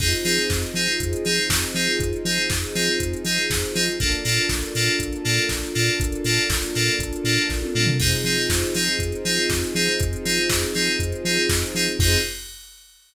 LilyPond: <<
  \new Staff \with { instrumentName = "Electric Piano 2" } { \time 4/4 \key f \dorian \tempo 4 = 120 <c' ees' f' aes'>8 <c' ees' f' aes'>4 <c' ees' f' aes'>4 <c' ees' f' aes'>4 <c' ees' f' aes'>8~ | <c' ees' f' aes'>8 <c' ees' f' aes'>4 <c' ees' f' aes'>4 <c' ees' f' aes'>4 <c' ees' f' aes'>8 | <bes d' f' a'>8 <bes d' f' a'>4 <bes d' f' a'>4 <bes d' f' a'>4 <bes d' f' a'>8~ | <bes d' f' a'>8 <bes d' f' a'>4 <bes d' f' a'>4 <bes d' f' a'>4 <bes d' f' a'>8 |
<c' ees' f' aes'>8 <c' ees' f' aes'>4 <c' ees' f' aes'>4 <c' ees' f' aes'>4 <c' ees' f' aes'>8~ | <c' ees' f' aes'>8 <c' ees' f' aes'>4 <c' ees' f' aes'>4 <c' ees' f' aes'>4 <c' ees' f' aes'>8 | <c' ees' f' aes'>4 r2. | }
  \new Staff \with { instrumentName = "Synth Bass 2" } { \clef bass \time 4/4 \key f \dorian f,8 f8 f,8 f8 f,8 f8 f,8 f8 | f,8 f8 f,8 f8 f,8 f8 f,8 f8 | bes,,8 bes,8 bes,,8 bes,8 bes,,8 bes,8 bes,,8 bes,8 | bes,,8 bes,8 bes,,8 bes,8 bes,,8 bes,8 bes,,8 bes,8 |
f,8 f8 f,8 f8 f,8 f8 f,8 f8 | f,8 f8 f,8 f8 f,8 f8 f,8 f8 | f,4 r2. | }
  \new Staff \with { instrumentName = "String Ensemble 1" } { \time 4/4 \key f \dorian <c' ees' f' aes'>1~ | <c' ees' f' aes'>1 | <bes d' f' a'>1~ | <bes d' f' a'>1 |
<c' ees' f' aes'>1~ | <c' ees' f' aes'>1 | <c' ees' f' aes'>4 r2. | }
  \new DrumStaff \with { instrumentName = "Drums" } \drummode { \time 4/4 <cymc bd>16 hh16 hho16 hh16 <bd sn>16 hh16 hho16 hh16 <hh bd>16 hh16 hho16 hh16 <bd sn>16 hh16 hho16 hh16 | <hh bd>16 hh16 hho16 hh16 <bd sn>16 hh16 hho16 hh16 <hh bd>16 hh16 hho16 hh16 <bd sn>16 hh16 hho16 hh16 | <hh bd>16 hh16 hho16 hh16 <bd sn>16 hh16 hho16 hh16 <hh bd>16 hh16 hho16 hh16 <bd sn>16 hh16 hho16 hh16 | <hh bd>16 hh16 hho16 hh16 <bd sn>16 hh16 hho16 hh16 <hh bd>16 hh16 hho16 hh16 <bd sn>16 tommh16 toml16 tomfh16 |
<cymc bd>16 hh16 hho16 hh16 <bd sn>16 hh16 hho16 hh16 <hh bd>16 hh16 hho16 hh16 <bd sn>16 hh16 hho16 hh16 | <hh bd>16 hh16 hho16 hh16 <bd sn>16 hh16 hho16 hh16 <hh bd>16 hh16 hho16 hh16 <bd sn>16 hh16 hho16 hh16 | <cymc bd>4 r4 r4 r4 | }
>>